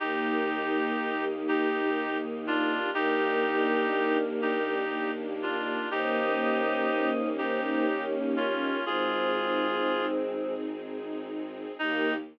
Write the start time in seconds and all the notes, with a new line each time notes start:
0.00 D#2 A#3 D#4 G4
0.49 D#4
0.98 D#2 G4
1.47 A#3 D#4 G4
1.97 D#4
2.47 D4 F4 G4
2.94 D#2 A#3 D4 D#4 G4 A#4
3.44 D4
3.92 D#2 D#4
4.42 D#4 G4
4.93 A#3 G4
5.41 D4 F4
5.90 D#2 A#3 C#4 D#4 G4 C5 D#5
6.38 C#4
6.88 D#2 D#4
7.36 D#4 G4 C5
7.62 C5
7.86 A#3 C#4
8.36 C#4 F4
8.84 G#1 G#3 C4 D#4 F4 G#4
9.35 D#4
9.84 G#1 G#4
10.33 C4
10.81 D#4
11.32 G#4
11.79 D#2 A#3 D#4 G4